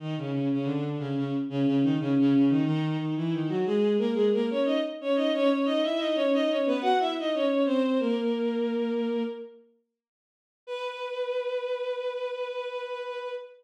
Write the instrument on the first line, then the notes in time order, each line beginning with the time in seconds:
violin
0.00 D#3 D#4
0.18 C#3 C#4
0.32 C#3 C#4
0.52 C#3 C#4
0.65 D3 D4
0.99 C#3 C#4
1.17 C#3 C#4
1.49 C#3 C#4
1.66 C#3 C#4
1.83 D#3 D#4
1.99 C#3 C#4
2.19 C#3 C#4
2.35 C#3 C#4
2.49 D#3 D#4
2.65 D#3 D#4
2.99 D#3 D#4
3.17 E3 E4
3.33 D#3 D#4
3.49 F#3 F#4
3.66 G#3 G#4
3.98 A#3 A#4
4.15 G#3 G#4
4.33 A#3 A#4
4.50 C#4 C#5
4.65 D#4 D#5
5.01 C#4 C#5
5.16 D#4 D#5
5.34 C#4 C#5
5.50 C#4 C#5
5.65 D#4 D#5
5.84 E4 E5
5.99 D#4 D#5
6.15 C#4 C#5
6.34 D#4 D#5
6.50 C#4 C#5
6.66 B3 B4
6.82 F#4 F#5
7.00 E4 E5
7.19 D#4 D#5
7.34 C#4 C#5
7.66 C4 C5
8.00 A#3 A#4
10.67 B4